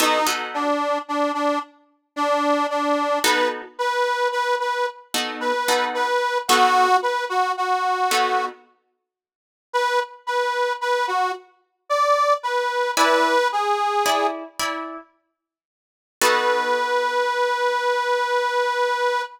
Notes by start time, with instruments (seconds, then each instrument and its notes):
0.00 acoustic guitar (steel) B3 D#4 F#4 A4, harmonica D#4
0.27 acoustic guitar (steel) B3 D#4 F#4 A4
0.54 harmonica D4
1.08 harmonica D4
1.34 harmonica D4
2.16 harmonica D4
2.70 harmonica D4
3.24 acoustic guitar (steel) B3 D#4 F#4 A4, harmonica B4
3.79 harmonica B4
4.32 harmonica B4
4.60 harmonica B4
5.14 acoustic guitar (steel) B3 D#4 F#4 A4
5.41 harmonica B4
5.68 acoustic guitar (steel) B3 D#4 F#4 A4
5.94 harmonica B4
6.48 acoustic guitar (steel) B3 D#4 F#4 A4, harmonica F#4
7.02 harmonica B4
7.30 harmonica F#4
7.57 harmonica F#4
8.11 acoustic guitar (steel) B3 D#4 F#4 A4
9.73 harmonica B4
10.27 harmonica B4
10.81 harmonica B4
11.08 harmonica F#4
11.89 harmonica D5
12.43 harmonica B4
12.97 acoustic guitar (steel) E4 D5 G#5 B5, harmonica B4
13.52 harmonica G#4
14.06 acoustic guitar (steel) E4 D5 G#5 B5
14.59 acoustic guitar (steel) E4 D5 G#5 B5
16.21 acoustic guitar (steel) B3 D#4 F#4 A4, harmonica B4